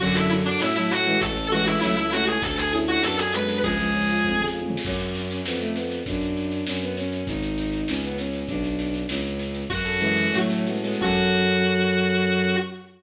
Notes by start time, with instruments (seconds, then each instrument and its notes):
0.00 violin F#2 D3 F#3, electric piano 1 C#4, clarinet F#4, kick, snare, crash
0.07 snare
0.15 clarinet E4, electric piano 1 A4, snare
0.23 snare
0.30 electric piano 1 C#4, snare
0.38 snare
0.45 clarinet D4, electric piano 1 F#4, snare
0.53 snare
0.60 violin A2 A3 C#4, electric piano 1 C#4, clarinet E4, snare
0.68 snare
0.76 violin F#3 A3, clarinet E4, electric piano 1 A4, snare
0.83 snare
0.91 clarinet F#4, electric piano 1 F#4, snare
0.98 snare
1.06 violin E3 G#3, electric piano 1 C#4, snare
1.14 snare
1.21 violin A1, electric piano 1 C#4, clarinet A4, kick, snare
1.29 snare
1.36 electric piano 1 A4, snare
1.44 snare
1.51 violin E3 G#3, electric piano 1 C#4, clarinet F#4, snare
1.59 snare
1.66 electric piano 1 E4, clarinet E4, snare
1.74 snare
1.81 violin C#2 F#3 A3, electric piano 1 C#4, clarinet E4, snare
1.89 snare
1.97 clarinet E4, electric piano 1 A4, snare
2.05 snare
2.12 violin A3 C#4, electric piano 1 E4, clarinet F#4, snare
2.20 snare
2.27 electric piano 1 C#4, clarinet G#4, snare
2.35 snare
2.42 violin D2, electric piano 1 D4, clarinet A4, kick, snare
2.50 snare
2.58 clarinet G#4, electric piano 1 A4, snare
2.65 snare
2.72 violin C#4 E4, electric piano 1 D4, snare
2.80 snare
2.88 clarinet F#4, electric piano 1 F#4, snare
2.95 snare
3.03 violin F#2 B3 D4, electric piano 1 D4, clarinet A4, snare
3.11 snare
3.18 clarinet G#4, electric piano 1 A4, snare
3.26 snare
3.33 violin G#3 B3, electric piano 1 F#4, clarinet B4, snare
3.41 snare
3.49 electric piano 1 D4, snare
3.56 snare
3.63 violin C#2 F3 G#3, electric piano 1 C#4, clarinet G#4, kick, snare
3.71 snare
3.78 violin F3 G#3, electric piano 1 G#4, snare
3.86 snare
3.94 electric piano 1 C#4, snare
4.02 snare
4.09 electric piano 1 F4, snare
4.17 snare
4.23 violin F2, electric piano 1 C#4, kick
4.32 mid tom
4.38 electric piano 1 G#4, floor tom
4.47 snare
4.54 electric piano 1 F4
4.62 mid tom
4.69 electric piano 1 C#4, floor tom
4.77 snare
4.85 violin F#2 C#4, kick, snare, crash
5.00 snare
5.15 snare
5.30 snare
5.45 violin F2 B3, snare
5.60 violin A3, snare
5.75 violin B3, snare
5.91 snare
6.06 violin F#2 D4, kick, snare
6.21 snare
6.36 snare
6.52 snare
6.67 violin F#2 C#4, snare
6.82 violin B3, snare
6.97 violin C#4, snare
7.12 snare
7.27 violin G#1 D#4, kick, snare
7.42 snare
7.58 snare
7.73 snare
7.88 violin C#2 C#4, snare
8.03 violin B3, snare
8.18 violin C#4, snare
8.33 snare
8.47 violin B1 D4, kick, snare
8.56 kick
8.64 snare
8.79 snare
8.94 snare
9.09 violin C#2 C#4, snare
9.24 snare
9.39 snare
9.55 snare
9.70 violin F#2, electric piano 1 C#4, clarinet F#4, kick, snare
9.77 snare
9.85 electric piano 1 A4, snare
9.93 snare
10.00 violin E3 G#3, electric piano 1 C#4, snare
10.09 snare
10.17 electric piano 1 F#4, snare
10.25 snare
10.32 violin A2 F#3 A3, electric piano 1 C#4, snare
10.41 snare
10.49 electric piano 1 A4, snare
10.58 snare
10.66 violin G#3 B3, electric piano 1 F#4, snare
10.75 snare
10.83 violin G#3 B3, electric piano 1 C#4, snare
10.93 snare
11.01 violin F#2 F#3, electric piano 1 C#4 F#4 A4, clarinet F#4, kick, crash